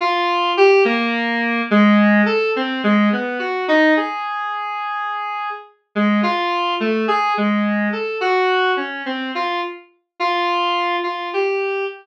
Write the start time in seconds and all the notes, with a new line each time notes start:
0.01 F4
0.57 G4
0.85 A#3
1.71 G#3
2.26 A4
2.56 C4
2.83 G#3
3.12 B3
3.39 F#4
3.68 D#4
3.97 G#4
5.95 G#3
6.23 F4
6.80 A3
7.08 G#4
7.37 G#3
7.92 A4
8.21 F#4
8.77 C#4
9.06 C4
9.35 F4
10.20 F4
11.03 F4
11.33 G4